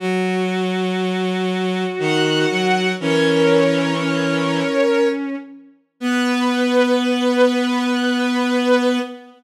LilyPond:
<<
  \new Staff \with { instrumentName = "Violin" } { \time 3/4 \key b \major \tempo 4 = 60 r2 fis''4 | <ais' cis''>2~ <ais' cis''>8 r8 | b'2. | }
  \new Staff \with { instrumentName = "Violin" } { \time 3/4 \key b \major fis'2. | cis'4 cis'4. r8 | b2. | }
  \new Staff \with { instrumentName = "Violin" } { \time 3/4 \key b \major fis2 dis8 fis8 | e2 r4 | b2. | }
>>